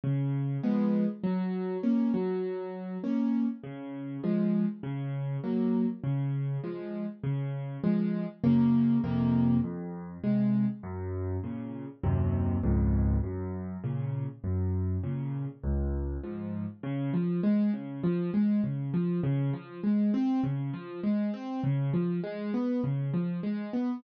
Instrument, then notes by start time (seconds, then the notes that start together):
acoustic grand piano
0.04 C#3
0.63 F3 G#3 B3
1.24 F#3
1.83 A#3 C#4
2.14 F#3
3.04 A#3 C#4
3.64 C#3
4.24 F3 G#3
4.83 C#3
5.44 F#3 A#3
6.04 C#3
6.64 F3 G#3
7.24 C#3
7.83 F3 G#3
8.44 F#2 C#3 A#3
9.04 F2 C3 A#3
9.64 F2
10.24 C3 G#3
10.83 F#2
11.44 A#2 C#3
12.04 D#2 F#2 C3
12.63 C#2 F2 G#2
13.23 F#2
13.84 A#2 C#3
14.44 F#2
15.03 A#2 C#3
15.63 C#2
16.23 G#2 F3
16.83 C#3
17.14 F3
17.43 G#3
17.73 C#3
18.04 F3
18.34 G#3
18.64 C#3
18.94 F3
19.23 C#3
19.53 F3
19.84 G#3
20.14 C4
20.43 C#3
20.73 F3
21.03 G#3
21.34 C4
21.64 C#3
21.93 F3
22.23 G#3
22.54 B3
22.84 C#3
23.14 F3
23.43 G#3
23.73 B3